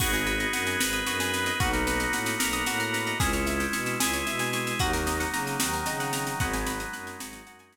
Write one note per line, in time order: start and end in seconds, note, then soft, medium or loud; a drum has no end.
0.00 0.45 G#1 medium
0.00 0.80 B3 medium
0.00 0.80 D#4 medium
0.00 0.12 F#4 medium
0.00 0.80 F#4 medium
0.00 0.80 G#4 medium
0.00 kick loud
0.00 snare loud
0.00 crash loud
0.13 0.26 G#4 medium
0.13 snare medium
0.26 0.39 B4 medium
0.26 snare medium
0.40 0.52 D#5 medium
0.40 snare medium
0.53 0.76 F#2 medium
0.53 0.65 F#5 medium
0.53 snare loud
0.67 0.79 G#5 medium
0.67 snare medium
0.79 1.02 G#1 medium
0.79 1.59 B3 medium
0.79 1.59 D#4 medium
0.79 1.59 G#4 medium
0.79 1.59 B4 medium
0.79 0.92 B5 medium
0.79 snare loud
0.93 1.05 D#6 medium
0.93 snare medium
1.06 1.51 F#2 medium
1.06 1.19 F#4 medium
1.06 snare loud
1.20 1.32 G#4 medium
1.20 snare loud
1.34 1.46 B4 medium
1.34 snare medium
1.46 1.59 D#5 medium
1.46 snare medium
1.60 2.06 B1 loud
1.60 2.39 A#3 medium
1.60 2.39 B3 medium
1.60 2.40 D#4 medium
1.60 1.72 F#4 medium
1.60 2.39 F#4 medium
1.60 kick loud
1.60 snare medium
1.73 1.85 A#4 medium
1.73 snare medium
1.87 1.99 B4 medium
1.87 snare loud
2.00 2.12 D#5 medium
2.00 snare medium
2.12 2.35 A2 medium
2.12 2.26 F#5 medium
2.12 snare loud
2.26 2.39 A#5 medium
2.26 snare loud
2.39 2.63 B1 medium
2.39 3.19 A#3 medium
2.39 3.19 B3 medium
2.39 3.19 F#4 medium
2.39 3.19 A#4 medium
2.39 2.52 B5 medium
2.39 snare loud
2.53 2.65 D#6 medium
2.53 snare medium
2.66 3.12 A2 medium
2.66 2.79 F#4 medium
2.66 snare loud
2.80 2.92 A#4 medium
2.80 snare medium
2.94 3.06 B4 medium
2.94 snare medium
3.07 3.19 D#5 medium
3.07 snare medium
3.19 3.65 C#2 medium
3.19 3.99 G#3 medium
3.19 4.00 C#4 medium
3.19 3.99 E4 medium
3.19 3.32 G#4 medium
3.19 kick loud
3.19 snare loud
3.33 3.45 C#5 medium
3.33 snare medium
3.46 3.58 E5 medium
3.46 snare medium
3.60 3.72 G5 medium
3.60 snare medium
3.73 3.96 B2 medium
3.73 3.85 C#6 medium
3.73 snare loud
3.86 3.99 E6 medium
3.86 snare medium
4.00 4.23 C#2 medium
4.00 4.79 G#3 medium
4.00 4.79 E4 medium
4.00 4.79 G#4 medium
4.00 4.12 G#4 medium
4.00 snare loud
4.13 4.25 C#5 medium
4.13 snare medium
4.27 4.73 B2 medium
4.27 4.39 E5 medium
4.27 snare medium
4.39 4.52 G#5 medium
4.39 snare medium
4.53 4.65 C#6 medium
4.53 snare medium
4.67 4.79 E6 medium
4.67 snare medium
4.79 5.25 D#2 medium
4.79 5.60 F#3 medium
4.79 5.60 A#3 medium
4.79 5.60 D#4 medium
4.79 4.92 F#4 loud
4.79 kick loud
4.79 snare medium
4.93 5.06 A#4 medium
4.93 snare medium
5.07 5.19 D#5 medium
5.07 snare loud
5.20 5.32 F#5 medium
5.20 snare medium
5.34 5.56 C#3 medium
5.34 5.46 A#5 medium
5.34 snare medium
5.47 5.59 D#6 medium
5.47 snare medium
5.59 5.82 D#2 medium
5.59 6.39 D#3 medium
5.59 6.39 F#3 medium
5.59 6.39 D#4 medium
5.59 5.72 F#4 medium
5.59 snare loud
5.73 5.85 A#4 medium
5.73 snare medium
5.86 6.32 C#3 medium
5.86 5.99 D#5 medium
5.86 snare loud
6.00 6.12 F#5 medium
6.00 snare medium
6.13 6.25 A#5 medium
6.13 snare loud
6.27 6.39 D#6 medium
6.27 snare medium
6.39 6.84 G#1 medium
6.39 7.20 F#3 loud
6.39 7.20 G#3 medium
6.39 7.20 B3 medium
6.39 7.20 D#4 medium
6.39 6.52 F#5 medium
6.39 kick loud
6.39 snare medium
6.53 6.66 G#5 medium
6.53 snare medium
6.67 6.79 B5 medium
6.67 snare loud
6.80 6.92 D#6 medium
6.80 snare medium
6.93 7.16 F#2 medium
6.93 7.05 F#6 medium
6.93 snare medium
7.07 7.19 G#6 medium
7.07 snare medium
7.19 7.42 G#1 medium
7.19 7.76 F#3 medium
7.19 7.76 G#3 medium
7.19 7.76 D#4 medium
7.19 7.76 F#4 medium
7.19 7.32 B6 medium
7.19 snare loud
7.33 7.45 D#7 medium
7.33 snare loud
7.47 7.76 F#2 medium
7.47 7.59 F#5 medium
7.47 snare medium
7.59 7.72 G#5 medium
7.59 snare medium
7.73 7.76 B5 medium
7.73 snare loud